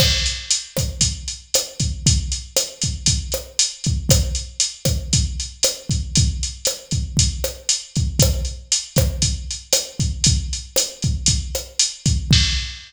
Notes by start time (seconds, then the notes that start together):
0.00 kick, cross-stick, crash
0.26 closed hi-hat
0.51 closed hi-hat
0.77 kick, cross-stick, closed hi-hat
1.01 kick, closed hi-hat
1.28 closed hi-hat
1.54 cross-stick, closed hi-hat
1.80 kick, closed hi-hat
2.06 kick, closed hi-hat
2.32 closed hi-hat
2.57 cross-stick, closed hi-hat
2.82 kick, closed hi-hat
3.06 kick, closed hi-hat
3.32 cross-stick, closed hi-hat
3.59 closed hi-hat
3.84 kick, closed hi-hat
4.09 kick, cross-stick, closed hi-hat
4.35 closed hi-hat
4.60 closed hi-hat
4.85 kick, cross-stick, closed hi-hat
5.13 kick, closed hi-hat
5.40 closed hi-hat
5.63 cross-stick, closed hi-hat
5.90 kick, closed hi-hat
6.15 kick, closed hi-hat
6.43 closed hi-hat
6.65 cross-stick, closed hi-hat
6.91 kick, closed hi-hat
7.17 kick, closed hi-hat
7.44 cross-stick, closed hi-hat
7.69 closed hi-hat
7.96 kick, closed hi-hat
8.19 kick, cross-stick, closed hi-hat
8.45 closed hi-hat
8.72 closed hi-hat
8.96 kick, cross-stick, closed hi-hat
9.22 kick, closed hi-hat
9.51 closed hi-hat
9.73 cross-stick, closed hi-hat
9.99 kick, closed hi-hat
10.24 kick, closed hi-hat
10.53 closed hi-hat
10.76 cross-stick, closed hi-hat
11.02 kick, closed hi-hat
11.26 kick, closed hi-hat
11.55 cross-stick, closed hi-hat
11.79 closed hi-hat
12.06 kick, closed hi-hat
12.31 kick, crash